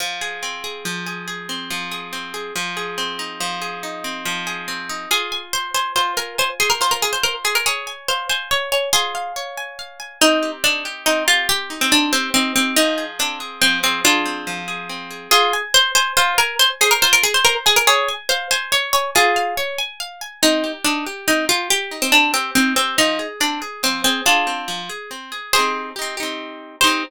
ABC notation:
X:1
M:6/8
L:1/16
Q:3/8=94
K:Fm
V:1 name="Pizzicato Strings"
z12 | z12 | z12 | z12 |
A3 z c2 c2 c2 B2 | c z A B c B A c B z A B | A3 z c2 c2 d2 d2 | [FA]4 z8 |
[K:Cm] E3 z D2 z2 E2 F2 | G3 C D2 C2 C2 C2 | E3 z D2 z2 C2 C2 | [DF]6 z6 |
[K:Fm] A3 z c2 c2 c2 B2 | c z A B c B A c B z A B | A3 z c2 c2 d2 d2 | [FA]4 z8 |
[K:Cm] E3 z D2 z2 E2 F2 | G3 C D2 C2 C2 C2 | E3 z D2 z2 C2 C2 | [DF]6 z6 |
[Ac]4 z8 | c6 z6 |]
V:2 name="Acoustic Guitar (steel)"
F,2 A2 C2 A2 F,2 A2 | A2 C2 F,2 A2 C2 A2 | F,2 A2 C2 E2 F,2 A2 | E2 C2 F,2 A2 C2 E2 |
F2 a2 c2 a2 F2 a2 | a2 c2 F2 a2 c2 a2 | d2 a2 f2 a2 d2 a2 | a2 f2 d2 a2 f2 a2 |
[K:Cm] C2 G2 E2 G2 C2 G2 | G2 E2 C2 G2 E2 G2 | F,2 A2 C2 A2 F,2 A2 | A2 C2 F,2 A2 C2 A2 |
[K:Fm] F2 a2 c2 a2 F2 a2 | a2 c2 F2 a2 c2 a2 | d2 a2 f2 a2 d2 a2 | a2 f2 d2 a2 f2 a2 |
[K:Cm] C2 G2 E2 G2 C2 G2 | G2 E2 C2 G2 E2 G2 | F,2 A2 C2 A2 F,2 A2 | A2 C2 F,2 A2 C2 A2 |
[CEG]4 [CEG]2 [CEG]6 | [CEG]6 z6 |]